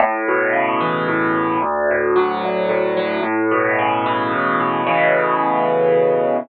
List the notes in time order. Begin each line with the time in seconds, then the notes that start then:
0.00 A2
0.28 B2
0.53 C#3
0.81 E3
1.08 A2
1.35 B2
1.62 D2
1.91 A2
2.16 F#3
2.44 D2
2.69 A2
2.97 F#3
3.23 A2
3.51 B2
3.79 C#3
4.06 E3
4.32 A2
4.60 B2
4.87 A2 B2 C#3 E3